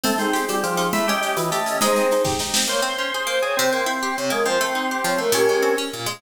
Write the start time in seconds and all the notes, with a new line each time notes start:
0.04 A3 C4 A4, low conga, shaker
0.18 C4 D#4 G#4, shaker
0.33 G4 G#4, shaker
0.48 G3 A4, high conga, shaker
0.63 F3 G4, shaker
0.77 D#4, shaker
0.93 A3 E4 E5, low conga, shaker
1.07 C#4 G4 D#5, shaker
1.22 G4 D#5, shaker
1.36 E3 B4, high conga, shaker
1.51 A3 G4, shaker
1.66 C#4, shaker
1.81 G#3 D#4 G#4 C5, low conga, shaker
1.96 C4, shaker
2.11 D#4, shaker
2.25 G4, kick, snare
2.39 D#4, snare
2.54 C4, snare
2.67 A#3 C5 C#5
2.82 C4
2.98 C#4
3.14 G#4
3.27 A#3 C5
3.42 C4 G#4 C#5
3.57 C3 C4 C5
3.73 A#3
3.86 E4
4.03 G4
4.16 C3 C#5
4.30 G#3 A#3 A#4
4.46 F3 C4 C5
4.61 A3
4.75 D#4
4.91 G4
5.04 F3 C#5
5.18 A3 A#4
5.32 A#2 C#4 G4 A#4
5.49 G#3
5.63 C4
5.78 C#4
5.93 A#2
6.06 G#3